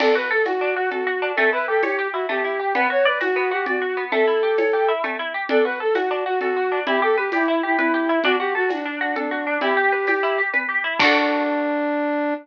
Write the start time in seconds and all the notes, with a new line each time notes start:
0.00 D4 A4, crash, cowbell, low conga
0.15 F#4 B4
0.31 A4
0.45 F#4, tambourine, cowbell, high conga
0.61 D4
0.76 F#4
0.91 F#4 A4, cowbell, low conga
1.07 F#4
1.22 D4
1.36 A3 A4, cowbell, low conga
1.53 E4 B4
1.68 G4 A4
1.83 G4 C#5, tambourine, cowbell, high conga
1.99 G4
2.13 E4 F#4
2.29 A3 G4, cowbell, low conga
2.44 E4
2.59 G4
2.75 B3 B4, cowbell, low conga
2.90 F#4 C#5
3.05 B4 D5
3.20 F#4, tambourine, cowbell, high conga
3.36 B3
3.51 F#4 G4
3.66 F#4 D5, cowbell, low conga
3.82 F#4
3.97 B3
4.12 A3 A4, cowbell, low conga
4.27 E4
4.43 G4
4.58 C#5, tambourine, cowbell, high conga
4.73 G4
4.88 E4
5.04 A3, cowbell, low conga
5.19 E4
5.34 G4
5.49 D4 A4, cowbell, low conga
5.64 F#4 B4
5.80 A4
5.94 F#4, tambourine, cowbell, high conga
6.11 D4
6.26 F#4
6.40 F#4 A4, cowbell, low conga
6.56 F#4
6.72 D4
6.87 E4 G4, cowbell, low conga
7.02 G4 A4
7.17 G4 B4
7.32 E4 G4, tambourine, cowbell, high conga
7.48 E4
7.63 E4 G4
7.77 E4 B4, cowbell, low conga
7.94 G4
8.09 E4
8.24 D4 F#4, cowbell, low conga
8.39 F#4 G4
8.55 F#4 A4
8.69 D4 F#4, tambourine, cowbell, high conga
8.85 D4
9.01 D4 F#4
9.16 D4 A4, cowbell, low conga
9.31 F#4
9.47 D4
9.61 E4 G4, cowbell, low conga
9.77 G4
9.92 B4
10.07 G4, tambourine, cowbell, high conga
10.23 E4
10.38 G4
10.53 B4, cowbell, low conga
10.69 G4
10.84 E4
10.99 D4 F#4, kick, crash
11.05 A4